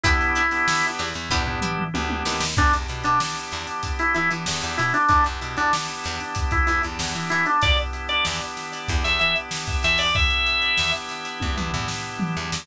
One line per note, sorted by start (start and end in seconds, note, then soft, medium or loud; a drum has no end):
0.03 0.33 E2 medium
0.03 0.42 B3 loud
0.03 0.42 D4 loud
0.03 0.15 D4 medium
0.03 0.86 E4 medium
0.03 0.42 E4 loud
0.03 0.15 E4 medium
0.03 0.42 G4 loud
0.03 0.15 G4 medium
0.03 0.15 B4 loud
0.03 kick loud
0.03 closed hi-hat loud
0.21 closed hi-hat medium
0.35 0.58 D4 medium
0.35 0.58 E4 medium
0.35 0.58 G4 medium
0.35 0.58 B4 medium
0.35 closed hi-hat medium
0.51 1.02 B3 loud
0.51 1.02 D4 medium
0.51 1.02 E4 medium
0.51 1.02 G4 medium
0.51 snare medium
0.51 closed hi-hat medium
0.68 snare loud
0.83 closed hi-hat medium
0.99 1.14 E2 medium
0.99 1.10 D4 medium
0.99 1.10 E4 medium
0.99 1.10 G4 medium
0.99 1.10 B4 medium
0.99 closed hi-hat medium
1.14 1.29 E2 medium
1.14 closed hi-hat medium
1.30 1.60 E2 medium
1.30 1.43 B3 loud
1.30 1.43 D4 loud
1.30 1.42 D4 medium
1.30 1.43 E4 loud
1.30 1.42 E4 medium
1.30 1.43 G4 loud
1.30 1.42 G4 medium
1.30 1.42 B4 medium
1.30 kick medium
1.30 floor tom medium
1.45 1.84 B3 medium
1.45 1.84 D4 loud
1.45 1.84 E4 loud
1.45 1.84 G4 medium
1.45 floor tom medium
1.61 1.84 D4 medium
1.61 1.84 E4 medium
1.61 1.84 G4 medium
1.61 1.84 B4 medium
1.61 mid tom medium
1.78 mid tom medium
1.94 2.23 D2 medium
1.94 2.44 B3 medium
1.94 2.44 D4 loud
1.94 2.44 E4 medium
1.94 2.44 G4 medium
1.94 high tom medium
2.10 high tom medium
2.25 2.55 D#2 medium
2.25 2.36 D4 medium
2.25 2.36 E4 medium
2.25 2.36 G4 medium
2.25 2.36 B4 medium
2.25 snare loud
2.40 snare loud
2.56 2.72 E2 medium
2.56 5.04 B3 medium
2.56 5.04 D4 medium
2.56 2.73 D4 loud
2.56 5.04 E4 medium
2.56 5.04 G4 medium
2.56 kick loud
2.56 crash medium
2.73 2.87 E2 medium
2.73 closed hi-hat medium
2.88 3.04 B2 medium
2.88 closed hi-hat medium
3.04 3.19 B2 medium
3.04 3.19 D4 medium
3.04 closed hi-hat medium
3.20 snare loud
3.36 closed hi-hat medium
3.51 3.67 E2 medium
3.51 snare medium
3.51 closed hi-hat medium
3.67 closed hi-hat medium
3.83 kick medium
3.83 closed hi-hat loud
3.99 4.14 E4 medium
3.99 closed hi-hat medium
4.14 4.30 E3 medium
4.14 4.29 E4 medium
4.14 closed hi-hat medium
4.31 4.45 E3 medium
4.31 closed hi-hat medium
4.46 4.62 E2 medium
4.46 snare loud
4.62 4.78 E2 medium
4.62 closed hi-hat medium
4.77 4.93 B2 medium
4.77 4.93 E4 medium
4.77 snare soft
4.77 closed hi-hat medium
4.94 5.08 D4 medium
4.94 closed hi-hat medium
5.09 5.24 E2 medium
5.09 7.57 B3 medium
5.09 5.24 D4 loud
5.09 7.57 D4 medium
5.09 7.57 E4 medium
5.09 7.57 G4 medium
5.09 kick loud
5.09 closed hi-hat loud
5.24 5.40 E2 medium
5.24 closed hi-hat medium
5.41 5.56 B2 medium
5.41 closed hi-hat medium
5.57 5.72 E2 medium
5.57 5.72 D4 medium
5.57 closed hi-hat medium
5.73 snare loud
5.88 closed hi-hat medium
6.04 6.20 E2 medium
6.04 snare medium
6.04 closed hi-hat medium
6.20 closed hi-hat medium
6.35 kick medium
6.35 closed hi-hat loud
6.51 6.66 E4 medium
6.51 kick loud
6.51 closed hi-hat medium
6.67 6.82 E2 medium
6.67 6.82 E4 medium
6.67 closed hi-hat medium
6.83 6.99 E2 medium
6.83 closed hi-hat medium
6.99 7.14 E2 medium
6.99 snare loud
7.14 7.29 E3 medium
7.14 closed hi-hat medium
7.29 7.46 E3 medium
7.29 7.45 E4 medium
7.29 closed hi-hat medium
7.46 7.61 D4 medium
7.46 closed hi-hat medium
7.61 7.77 E2 medium
7.61 10.10 B3 medium
7.61 10.10 D4 medium
7.61 10.10 E4 medium
7.61 10.10 G4 medium
7.61 7.77 D5 loud
7.61 kick loud
7.61 closed hi-hat loud
7.78 closed hi-hat medium
7.93 closed hi-hat medium
8.09 8.24 D5 medium
8.09 closed hi-hat medium
8.25 8.41 E2 medium
8.25 snare loud
8.41 closed hi-hat medium
8.57 snare medium
8.57 closed hi-hat medium
8.72 snare soft
8.72 closed hi-hat medium
8.88 9.04 E2 medium
8.88 kick loud
8.88 closed hi-hat loud
9.04 9.19 E2 medium
9.04 9.19 E5 medium
9.04 snare soft
9.04 closed hi-hat medium
9.19 9.35 E3 medium
9.19 9.34 E5 medium
9.19 closed hi-hat medium
9.36 closed hi-hat medium
9.51 snare loud
9.67 kick medium
9.67 closed hi-hat medium
9.83 10.30 E2 medium
9.83 9.99 E5 medium
9.83 closed hi-hat medium
9.98 10.14 D5 medium
9.98 open hi-hat medium
10.15 12.62 B3 medium
10.15 12.62 D4 medium
10.15 12.62 E4 medium
10.15 12.62 G4 medium
10.15 10.91 E5 medium
10.15 kick loud
10.15 open hi-hat medium
10.30 closed hi-hat medium
10.46 closed hi-hat medium
10.62 closed hi-hat medium
10.77 10.93 E2 medium
10.77 snare loud
10.93 closed hi-hat medium
11.08 snare medium
11.08 closed hi-hat medium
11.25 closed hi-hat medium
11.40 11.56 E2 medium
11.40 kick medium
11.40 high tom medium
11.57 11.72 E2 medium
11.57 mid tom medium
11.73 11.88 E2 medium
11.73 floor tom medium
11.88 snare loud
12.19 mid tom loud
12.37 12.51 E2 medium
12.52 12.67 E2 medium
12.52 snare loud